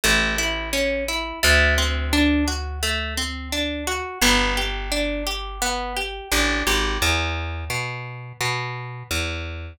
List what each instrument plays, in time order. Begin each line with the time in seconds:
0.04 electric bass (finger) A1, orchestral harp A3
0.38 orchestral harp E4
0.73 orchestral harp C#4
1.08 orchestral harp E4
1.43 electric bass (finger) D2, orchestral harp A3
1.78 orchestral harp C4
2.13 orchestral harp D4
2.48 orchestral harp F#4
2.83 orchestral harp A3
3.17 orchestral harp C4
3.52 orchestral harp D4
3.87 orchestral harp F#4
4.22 electric bass (finger) G1, orchestral harp B3
4.57 orchestral harp G4
4.92 orchestral harp D4
5.27 orchestral harp G4
5.62 orchestral harp B3
5.97 orchestral harp G4
6.32 electric bass (finger) A1, orchestral harp D4
6.67 electric bass (finger) G#1, orchestral harp G4
7.02 electric bass (finger) E2
7.70 electric bass (finger) B2
8.41 electric bass (finger) B2
9.11 electric bass (finger) E2